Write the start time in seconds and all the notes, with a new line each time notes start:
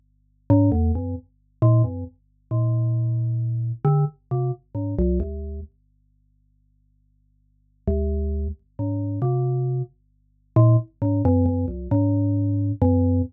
0.50 G#2
0.72 E2
0.95 F#2
1.62 A#2
1.84 F#2
2.51 A#2
3.85 D3
4.31 C3
4.75 G#2
4.99 C2
5.20 D2
7.87 D2
8.79 G#2
9.22 C3
10.56 A#2
11.02 G#2
11.25 F#2
11.46 F#2
11.68 C2
11.91 G#2
12.82 F#2